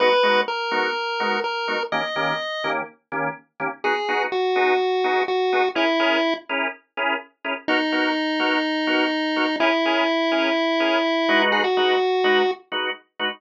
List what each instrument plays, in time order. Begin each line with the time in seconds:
0.00 drawbar organ G#3 B3 D#4 F#4, lead 1 (square) B4
0.23 drawbar organ G#3 B3 D#4 F#4
0.48 lead 1 (square) A#4
0.71 drawbar organ G#3 B3 D#4 F#4
1.20 drawbar organ G#3 B3 D#4 F#4
1.44 lead 1 (square) A#4
1.68 drawbar organ G#3 B3 D#4 F#4
1.92 drawbar organ D#3 A#3 C#4 G4, lead 1 (square) D#5
2.16 drawbar organ D#3 A#3 C#4 G4
2.64 drawbar organ D#3 A#3 C#4 G4
3.12 drawbar organ D#3 A#3 C#4 G4
3.60 drawbar organ D#3 A#3 C#4 G4
3.84 drawbar organ B3 D#4 F#4 G#4, lead 1 (square) G#4
4.08 drawbar organ B3 D#4 F#4 G#4
4.32 lead 1 (square) F#4
4.55 drawbar organ B3 D#4 F#4 G#4
5.04 drawbar organ B3 D#4 F#4 G#4
5.28 lead 1 (square) F#4
5.53 drawbar organ B3 D#4 F#4 G#4
5.75 drawbar organ C#4 E4 G#4 A#4, lead 1 (square) E4
5.99 drawbar organ C#4 E4 G#4 A#4
6.49 drawbar organ C#4 E4 G#4 A#4
6.97 drawbar organ C#4 E4 G#4 A#4
7.44 drawbar organ C#4 E4 G#4 A#4
7.68 drawbar organ B3 D#4 F#4 A#4, lead 1 (square) D#4
7.92 drawbar organ B3 D#4 F#4 A#4
8.39 drawbar organ B3 D#4 F#4 A#4
8.87 drawbar organ B3 D#4 F#4 A#4
9.36 drawbar organ B3 D#4 F#4 A#4
9.60 drawbar organ C#4 E4 G#4 A#4, lead 1 (square) E4
9.85 drawbar organ C#4 E4 G#4 A#4
10.31 drawbar organ C#4 E4 G#4 A#4
10.80 drawbar organ C#4 E4 G#4 A#4
11.29 drawbar organ G#3 D#4 F#4 B4
11.52 lead 1 (square) G#4
11.64 lead 1 (square) F#4
11.77 drawbar organ G#3 D#4 F#4 B4
12.24 drawbar organ G#3 D#4 F#4 B4
12.72 drawbar organ G#3 D#4 F#4 B4
13.19 drawbar organ G#3 D#4 F#4 B4